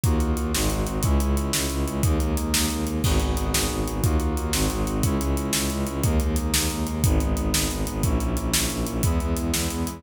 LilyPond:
<<
  \new Staff \with { instrumentName = "Brass Section" } { \time 6/8 \key gis \minor \tempo 4. = 120 <ais dis' eis' fis'>4. <gis bis dis' fis'>4. | <gis cis' e'>2. | <gis ais dis'>2. | <b dis' fis' gis'>2. |
<ais dis' eis' fis'>4. <gis bis dis' fis'>4. | <gis cis' e'>2. | <gis ais dis'>2. | <gis b dis'>2. |
<ais cis' e'>2. | <gis b e'>2. | }
  \new Staff \with { instrumentName = "Violin" } { \clef bass \time 6/8 \key gis \minor dis,8 dis,8 dis,8 gis,,8 gis,,8 gis,,8 | cis,8 cis,8 cis,8 cis,8 cis,8 cis,8 | dis,8 dis,8 dis,8 dis,8 dis,8 dis,8 | gis,,8 gis,,8 gis,,8 gis,,8 gis,,8 gis,,8 |
dis,8 dis,8 dis,8 gis,,8 gis,,8 gis,,8 | cis,8 cis,8 cis,8 cis,8 cis,8 cis,8 | dis,8 dis,8 dis,8 dis,8 dis,8 dis,8 | gis,,8 gis,,8 gis,,8 gis,,8 gis,,8 gis,,8 |
ais,,8 ais,,8 ais,,8 ais,,8 ais,,8 ais,,8 | e,8 e,8 e,8 e,8 e,8 e,8 | }
  \new DrumStaff \with { instrumentName = "Drums" } \drummode { \time 6/8 <hh bd>8 hh8 hh8 sn8 hh8 hh8 | <hh bd>8 hh8 hh8 sn8 hh8 hh8 | <hh bd>8 hh8 hh8 sn8 hh8 hh8 | <cymc bd>8 hh8 hh8 sn4 hh8 |
<hh bd>8 hh8 hh8 sn8 hh8 hh8 | <hh bd>8 hh8 hh8 sn8 hh8 hh8 | <hh bd>8 hh8 hh8 sn8 hh8 hh8 | <hh bd>8 hh8 hh8 sn8 hh8 hh8 |
<hh bd>8 hh8 hh8 sn8 hh8 hh8 | <hh bd>8 hh8 hh8 sn8 hh8 hh8 | }
>>